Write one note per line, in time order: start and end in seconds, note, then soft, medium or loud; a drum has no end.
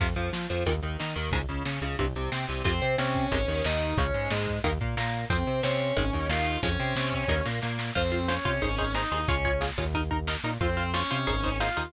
0.00 0.14 F2 medium
0.00 0.07 C3 medium
0.00 0.07 F3 medium
0.00 kick loud
0.00 crash medium
0.16 0.30 F2 medium
0.16 0.30 F3 medium
0.16 closed hi-hat medium
0.33 0.47 F3 medium
0.33 0.48 F4 medium
0.33 snare loud
0.49 0.64 F2 medium
0.49 0.64 F3 medium
0.49 closed hi-hat medium
0.66 0.80 D#2 medium
0.66 0.73 A#2 medium
0.66 0.73 D#3 medium
0.66 kick medium
0.66 closed hi-hat loud
0.82 0.97 D#2 medium
0.82 0.97 D#3 medium
0.82 closed hi-hat medium
1.00 1.15 D#3 medium
1.00 1.14 D#4 medium
1.00 snare loud
1.16 1.30 D#2 medium
1.16 1.30 D#3 medium
1.16 closed hi-hat medium
1.31 1.45 C#2 medium
1.31 1.39 G#2 loud
1.31 1.39 C#3 medium
1.31 kick loud
1.31 closed hi-hat loud
1.49 1.63 C#2 medium
1.49 1.63 C#3 medium
1.49 closed hi-hat medium
1.65 1.79 C#3 medium
1.65 1.80 C#4 medium
1.65 snare loud
1.82 1.96 C#2 medium
1.82 1.96 C#3 medium
1.82 closed hi-hat medium
1.99 2.14 C2 medium
1.99 2.06 G2 medium
1.99 2.06 C3 medium
1.99 kick medium
1.99 closed hi-hat medium
2.15 2.29 C2 medium
2.15 2.30 C3 medium
2.15 closed hi-hat medium
2.32 2.46 C3 medium
2.32 2.46 C4 medium
2.32 snare loud
2.48 2.63 C2 medium
2.48 2.62 C3 medium
2.48 open hi-hat medium
2.64 2.80 F2 medium
2.64 2.72 C3 medium
2.64 2.72 F3 medium
2.64 2.93 C4 medium
2.64 2.93 C5 loud
2.64 kick loud
2.64 closed hi-hat loud
2.82 2.96 C3 medium
2.82 2.96 C4 medium
2.98 3.26 C3 medium
2.98 3.26 C4 medium
2.98 3.63 C#4 medium
2.98 3.63 C#5 medium
2.98 snare loud
3.15 kick medium
3.32 3.46 G#1 medium
3.32 3.38 C3 loud
3.32 3.38 D#3 loud
3.32 3.38 G#3 loud
3.32 kick loud
3.32 closed hi-hat loud
3.48 3.62 D#2 medium
3.48 3.62 D#3 medium
3.65 3.94 D#2 medium
3.65 3.93 D#3 medium
3.65 3.96 D#4 medium
3.65 3.96 D#5 medium
3.65 snare loud
3.97 4.11 C#2 medium
3.97 4.05 C#3 medium
3.97 4.05 F3 medium
3.97 4.05 G#3 medium
3.97 4.29 C#4 medium
3.97 4.29 C#5 medium
3.97 kick loud
3.97 closed hi-hat loud
4.14 4.28 G#2 medium
4.14 4.28 G#3 medium
4.30 4.59 G#2 medium
4.30 4.59 G#3 medium
4.30 snare loud
4.47 kick medium
4.64 4.78 D#2 medium
4.64 4.71 D#3 loud
4.64 4.71 A#3 loud
4.64 kick medium
4.64 closed hi-hat loud
4.81 4.95 A#2 medium
4.81 4.95 A#3 medium
4.81 kick medium
4.97 5.25 A#2 medium
4.97 5.26 A#3 medium
4.97 snare loud
5.30 5.44 F2 medium
5.30 5.37 F3 medium
5.30 5.59 C4 medium
5.30 5.37 C4 medium
5.30 5.59 C5 medium
5.30 kick loud
5.30 closed hi-hat loud
5.47 5.61 C3 medium
5.47 5.61 C4 medium
5.63 5.92 C3 medium
5.63 5.92 C4 medium
5.63 6.26 C#4 medium
5.63 6.26 C#5 medium
5.63 snare loud
5.97 6.11 G#1 medium
5.97 6.03 D#3 loud
5.97 6.03 G#3 loud
5.97 6.03 C4 loud
5.97 kick medium
5.97 closed hi-hat loud
6.13 6.28 D#2 medium
6.13 6.27 D#3 medium
6.13 kick medium
6.29 6.57 D#2 medium
6.29 6.58 D#3 medium
6.29 6.57 F4 medium
6.29 6.57 F5 medium
6.29 snare loud
6.63 6.77 F2 medium
6.63 6.70 F3 medium
6.63 6.70 G#3 medium
6.63 6.70 C#4 medium
6.63 7.43 C#4 medium
6.63 7.43 C#5 medium
6.63 kick loud
6.63 closed hi-hat loud
6.80 6.94 C3 medium
6.80 6.94 C4 medium
6.96 7.24 C3 medium
6.96 7.25 C4 medium
6.96 snare loud
7.13 kick medium
7.28 7.42 D#2 medium
7.28 7.36 D#3 loud
7.28 7.36 A#3 medium
7.28 kick medium
7.28 snare medium
7.46 7.60 A#2 medium
7.46 7.60 A#3 medium
7.46 snare loud
7.62 7.91 A#2 medium
7.62 7.91 A#3 medium
7.62 snare medium
7.79 snare loud
7.95 8.38 F2 medium
7.95 8.26 C4 medium
7.95 8.02 F4 medium
7.95 8.02 C5 medium
7.95 8.26 C5 medium
7.95 kick loud
7.95 crash loud
8.12 8.19 F4 medium
8.12 8.19 C5 medium
8.28 8.93 C#4 medium
8.28 8.35 F4 medium
8.28 8.35 C5 medium
8.28 8.93 C#5 medium
8.28 snare loud
8.45 8.59 C3 medium
8.45 8.52 F4 medium
8.45 8.52 C5 medium
8.45 kick medium
8.62 9.05 G#1 medium
8.62 8.69 D#4 medium
8.62 8.69 G#4 loud
8.62 8.69 C5 medium
8.62 kick medium
8.62 closed hi-hat loud
8.78 8.85 D#4 medium
8.78 8.85 G#4 medium
8.78 8.85 C5 medium
8.78 kick medium
8.94 9.25 D#4 medium
8.94 9.02 D#4 medium
8.94 9.02 G#4 medium
8.94 9.02 C5 medium
8.94 9.25 D#5 medium
8.94 snare loud
9.12 9.26 D#2 medium
9.12 9.19 D#4 medium
9.12 9.19 G#4 medium
9.12 9.19 C5 medium
9.28 9.71 C#2 medium
9.28 9.60 C#4 medium
9.28 9.35 F4 loud
9.28 9.35 G#4 medium
9.28 9.35 C#5 medium
9.28 9.60 C#5 medium
9.28 kick loud
9.28 closed hi-hat loud
9.45 9.52 F4 medium
9.45 9.52 G#4 medium
9.45 9.52 C#5 medium
9.45 kick medium
9.61 9.68 F4 medium
9.61 9.68 G#4 medium
9.61 9.68 C#5 medium
9.61 snare loud
9.78 10.37 D#2 medium
9.78 9.85 F4 medium
9.78 9.85 G#4 medium
9.78 9.85 C#5 medium
9.78 kick medium
9.94 10.01 D#4 loud
9.94 10.01 A#4 loud
9.94 kick medium
9.94 closed hi-hat loud
10.11 10.17 D#4 medium
10.11 10.17 A#4 medium
10.11 kick medium
10.27 10.34 D#4 medium
10.27 10.34 A#4 medium
10.27 snare loud
10.43 10.58 A#2 medium
10.43 10.51 D#4 medium
10.43 10.51 A#4 medium
10.60 11.03 F2 medium
10.60 10.90 C4 medium
10.60 10.67 F4 loud
10.60 10.67 C5 medium
10.60 10.90 C5 medium
10.60 kick loud
10.60 closed hi-hat loud
10.77 10.83 F4 medium
10.77 10.83 C5 medium
10.94 11.57 C#4 medium
10.94 11.00 F4 medium
10.94 11.00 C5 medium
10.94 11.57 C#5 medium
10.94 snare loud
11.11 11.26 C3 medium
11.11 11.17 F4 medium
11.11 11.17 C5 medium
11.27 11.69 G#1 medium
11.27 11.34 D#4 medium
11.27 11.34 G#4 loud
11.27 11.34 C5 loud
11.27 kick medium
11.27 closed hi-hat loud
11.44 11.50 D#4 medium
11.44 11.50 G#4 medium
11.44 11.50 C5 medium
11.44 kick medium
11.60 11.67 D#4 medium
11.60 11.87 F4 medium
11.60 11.67 G#4 medium
11.60 11.67 C5 medium
11.60 11.87 F5 medium
11.60 snare loud
11.77 11.91 D#2 medium
11.77 11.83 D#4 medium
11.77 11.83 G#4 medium
11.77 11.83 C5 medium